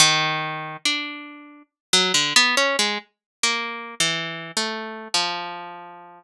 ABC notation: X:1
M:4/4
L:1/16
Q:1/4=70
K:none
V:1 name="Orchestral Harp"
_E,4 D4 z _G, D, B, _D _A, z2 | (3_B,4 E,4 A,4 F,8 |]